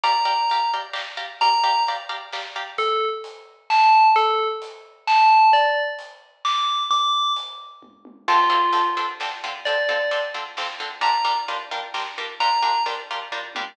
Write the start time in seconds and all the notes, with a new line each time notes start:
0.04 G4 D5 F5 A#5, kick, closed hi-hat
0.25 G4 D5 F5 A#5
0.50 G4 D5 F5 A#5, closed hi-hat
0.74 G4 D5 F5 A#5
0.93 G4 D5 F5 A#5, snare
1.17 G4 D5 F5 A#5
1.41 G4 D5 F5 A#5, kick, closed hi-hat
1.64 G4 D5 F5 A#5
1.87 G4 D5 F5 A#5, closed hi-hat
2.09 G4 D5 F5 A#5
2.33 G4 D5 F5 A#5, snare
2.56 G4 D5 F5 A#5
2.78 A4, kick, closed hi-hat
3.24 closed hi-hat
3.70 A5, snare
4.16 A4, kick, closed hi-hat
4.62 closed hi-hat
5.07 A5, snare
5.53 D5, kick, closed hi-hat
5.99 closed hi-hat
6.45 D6, snare
6.91 D6, kick, closed hi-hat
7.36 closed hi-hat
7.83 kick, high tom
8.05 high tom
8.28 D3 C4 F4 A4, kick, crash
8.50 D3 C4 F4 A4
8.73 D3 C4 F4 A4, closed hi-hat
8.97 D3 C4 F4 A4
9.20 D3 C4 F4 A4, snare
9.44 D3 C4 F4 A4
9.65 D3 C4 F4 A4 D5, kick, closed hi-hat
9.89 D3 C4 F4 A4
10.11 D3 C4 F4 A4, closed hi-hat
10.34 D3 C4 F4 A4
10.57 D3 C4 F4 A4, snare
10.80 D3 C4 F4 A4
11.01 G3 D4 F4 A#4 A#5, kick, closed hi-hat
11.25 G3 D4 F4 A#4
11.48 G3 D4 F4 A#4, closed hi-hat
11.71 G3 D4 F4 A#4
11.94 G3 D4 F4 A#4, snare
12.18 G3 D4 F4 A#4
12.40 G3 D4 F4 A#4 A#5, kick, closed hi-hat
12.62 G3 D4 F4 A#4
12.86 G3 D4 F4 A#4, closed hi-hat
13.11 G3 D4 F4 A#4
13.32 G3 D4 F4 A#4, kick, floor tom
13.55 G3 D4 F4 A#4, high tom